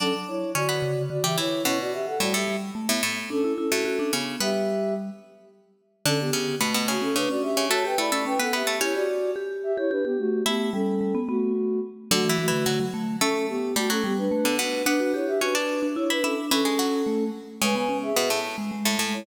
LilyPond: <<
  \new Staff \with { instrumentName = "Ocarina" } { \time 3/4 \key b \minor \tempo 4 = 109 <cis' a'>16 r16 <e' cis''>8 <fis' d''>4 <fis' d''>16 <g' e''>16 <e' cis''>8 | <e' cis''>16 <fis' d''>16 <g' e''>16 <a' fis''>16 <fis' d''>16 <g' e''>8 r4 r16 | \time 2/4 <cis' a'>8 <cis' a'>4 r8 | \time 3/4 <g' e''>4 r2 |
\key d \major <cis' a'>16 <b g'>8. r8 <a fis'>16 <cis' a'>16 <d' b'>16 <fis' d''>16 <g' e''>8 | \time 2/4 <cis'' a''>16 <b' g''>16 <d'' b''>8 <b' g''>16 <a' fis''>16 <g' e''>8 | \time 3/4 <e' cis''>16 <fis' d''>8. r8 <g' e''>16 <e' cis''>16 <d' b'>16 <b g'>16 <a fis'>8 | <b g'>8 <cis' a'>4 <a fis'>4 r8 |
\time 2/4 \key b \minor <a fis'>8 <a fis'>4 r8 | \time 3/4 <cis' a'>8 <b g'>8 <a fis'>16 <cis' a'>16 <b g'>16 <d' b'>8. <d' b'>8 | <d' b'>8 <e' cis''>16 <g' e''>16 <d' b'>4 <e' cis''>16 <d' b'>16 <cis' a'>16 r16 | \time 2/4 <cis' a'>4. r8 |
\time 3/4 \key cis \minor <b' gis''>16 <b' gis''>8 <gis' e''>8. r4 r16 <e' cis''>16 | }
  \new Staff \with { instrumentName = "Pizzicato Strings" } { \time 3/4 \key b \minor <d' d''>4 <cis' cis''>16 <b b'>8 r8 <g g'>16 <e e'>8 | <b, b>4 <a, a>16 <a, a>8 r8 <a, a>16 <a, a>8 | \time 2/4 r8. <a, a>8. <cis cis'>8 | \time 3/4 <b b'>4 r2 |
\key d \major <d d'>8 <cis cis'>8 <b, b>16 <b, b>16 <cis cis'>8 <cis cis'>16 r8 <cis cis'>16 | \time 2/4 <a a'>8 <a a'>16 <a a'>8 <b b'>16 <b b'>16 <a a'>16 | \time 3/4 <cis' cis''>2. | <e' e''>4 r2 |
\time 2/4 \key b \minor \tuplet 3/2 { <d d'>8 <e e'>8 <e e'>8 } <fis fis'>16 r8. | \time 3/4 <a a'>4 <g g'>16 <fis fis'>8 r8 <d d'>16 <b, b>8 | <b b'>4 <cis' cis''>16 <d' d''>8 r8 <e' e''>16 <e' e''>8 | \time 2/4 <e e'>16 <gis gis'>16 <fis fis'>8 r4 |
\time 3/4 \key cis \minor <cis cis'>4 <b, b>16 <a, a>8 r8 <a, a>16 <a, a>8 | }
  \new Staff \with { instrumentName = "Vibraphone" } { \time 3/4 \key b \minor fis16 r8. d8 cis8 d16 e16 r8 | cis'16 r8. g8 g8 a16 b16 r8 | \time 2/4 d'16 e'16 e'16 fis'16 fis'16 d'16 b8 | \time 3/4 g4. r4. |
\key d \major d8 r8 a8. cis'16 d'16 cis'8. | \time 2/4 fis'16 g'16 e'16 cis'16 cis'16 b8 r16 | \time 3/4 g'8 r8 g'8. g'16 g'16 g'8. | a8 g8 g16 b16 b8 r4 |
\time 2/4 \key b \minor fis16 e16 e16 d16 d16 fis16 a8 | \time 3/4 cis'16 r8. a8 g8 a16 b16 r8 | d'16 fis'16 g'8 fis'16 r8 d'16 e'8 d'8 | \time 2/4 cis'4 a8 r8 |
\time 3/4 \key cis \minor gis16 b16 cis'8 b16 r8 gis16 gis8 gis8 | }
>>